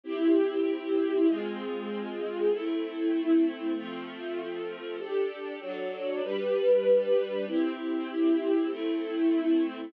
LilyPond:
\new Staff { \time 4/4 \key c \major \tempo 4 = 97 <c' e' g'>2 <aes c' f'>2 | <a c' e'>2 <f a c'>2 | <d' g' a'>4 <fis d' a'>4 <g d' b'>2 | <c' e' g'>2 <a c' e'>2 | }